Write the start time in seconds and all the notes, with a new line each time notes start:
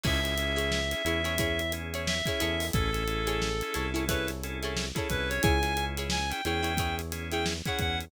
0.04 C#2 C#4 E4 G#4 C#5 E5, kick, crash
0.24 C#4 E4 G#4, closed hi-hat
0.38 C#4 E4 G#4, closed hi-hat
0.56 E4 G#4 C#5, snare, closed hi-hat
0.72 snare
0.91 C#4 E4 G#4, snare, closed hi-hat
1.05 E2 C#4 E4 G#4 C#5, closed hi-hat
1.24 E4 G#4 C#5, snare, closed hi-hat
1.38 E4 G#4 C#5, kick, closed hi-hat
1.59 closed hi-hat
1.72 C#4 E4 G#4, closed hi-hat
1.94 E4 G#4 C#5, closed hi-hat
2.07 E5, snare
2.26 C#4 E4 G#4 C#5, kick, snare, closed hi-hat
2.40 E2 E4 G#4 A4 C#5, closed hi-hat
2.60 open hi-hat
2.73 A1 C#4 E4 G#4 A4, kick, closed hi-hat
2.93 C#4 E4 G#4 A4, closed hi-hat
3.07 C#4 E4 G#4 A4, closed hi-hat
3.27 E4 G#4 A4 C#5, closed hi-hat
3.42 snare
3.61 C#4 E4 G#4 A4, closed hi-hat
3.74 C2 C#4 E4 G#4 A4 C#5, snare, closed hi-hat
3.94 E4 G#4 A4 C#5, closed hi-hat
4.08 E4 G#4 A4 B4 C#5, kick, closed hi-hat
4.27 snare, closed hi-hat
4.44 C#4 E4 G#4 A4, closed hi-hat
4.63 E4 G#4 A4 C#5, closed hi-hat
4.77 snare
4.95 C#4 E4 G#4 A4 C#5, kick, closed hi-hat
5.09 C2 C#4 E4 G#4 B4, kick, closed hi-hat
5.29 C#5, snare, closed hi-hat
5.42 C#2 E4 G#4 C#5 G#5, kick, closed hi-hat
5.62 C#4 E4 G#4, snare, closed hi-hat
5.77 C#4 E4 G#4, closed hi-hat
5.97 E4 G#4 C#5, closed hi-hat
6.10 G#5, snare
6.30 C#4 E4 G#4 G5, closed hi-hat
6.44 E2 C#4 E4 G#4 C#5 G5, closed hi-hat
6.63 E4 G#4 C#5, closed hi-hat
6.77 E4 G#4 C#5, kick, closed hi-hat
6.99 closed hi-hat
7.12 C#4 E4 G#4, snare, closed hi-hat
7.31 E4 G#4 C#5 G5, closed hi-hat
7.46 snare
7.65 C#4 E4 G#4 C#5 F#5, kick, closed hi-hat
7.79 E2 F#5, kick, closed hi-hat
8.01 closed hi-hat